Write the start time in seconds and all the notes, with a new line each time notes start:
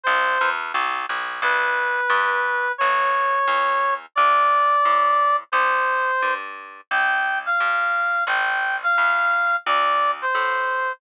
0.03 C2 C5
0.41 E2
0.74 C2
1.09 B1
1.42 C2 B4
2.10 G2
2.78 A1 C#5
3.47 E2
4.15 D2 D5
4.85 A2
5.52 C2 C5
6.22 G2
6.91 C2 G5
7.46 F5
7.60 G2
8.27 A1 G5
8.83 F5
8.98 E2
9.66 D2 D5
10.22 C5
10.35 A2